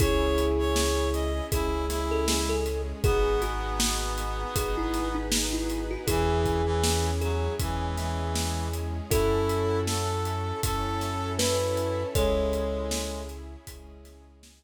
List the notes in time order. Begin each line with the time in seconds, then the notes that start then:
0.00 C#2 C#4 E4 G#4 C#5, kick, closed hi-hat
0.38 closed hi-hat
0.59 C#5
0.76 snare
1.13 D#5, closed hi-hat
1.52 C#2 G#3 C#4 E4 G#4, kick, closed hi-hat
1.90 E4, snare, closed hi-hat
2.11 A4
2.28 G#4, snare
2.49 A4
2.66 closed hi-hat
3.04 G#1 B3 D#4 F#4 G#4, kick, closed hi-hat
3.42 F#4, snare, closed hi-hat
3.80 snare
4.18 closed hi-hat
4.56 G#1 B3 D#4 F#4 G#4 B4, kick, closed hi-hat
4.77 E4
4.94 snare, closed hi-hat
5.15 D#4
5.32 snare
5.53 E4
5.70 closed hi-hat
5.91 F#4
6.07 E2 E3 C#4 E4 G#4, kick, closed hi-hat
6.46 kick, closed hi-hat
6.65 E3
6.84 snare
7.21 F#3 G#4, closed hi-hat
7.59 E2 E3 G#3 C#4 E4 G#4, kick, closed hi-hat
7.97 E3, snare, closed hi-hat
8.35 snare
8.73 closed hi-hat
9.10 F#2 C#4 E4 F#4 A4, kick, closed hi-hat
9.49 closed hi-hat
9.87 A4, snare
10.25 closed hi-hat
10.63 F#2 C#4 E4 F#4 A4 C#5, kick, closed hi-hat
11.01 snare, closed hi-hat
11.39 E4 B4, snare
11.77 closed hi-hat
12.15 C#2 G#3 C#4 E4 G#4 A4 C#5, kick, closed hi-hat
12.53 closed hi-hat
12.91 snare
13.29 closed hi-hat
13.67 C#2 G#3 C#4 E4 G#4, kick, closed hi-hat
14.05 snare, closed hi-hat
14.43 snare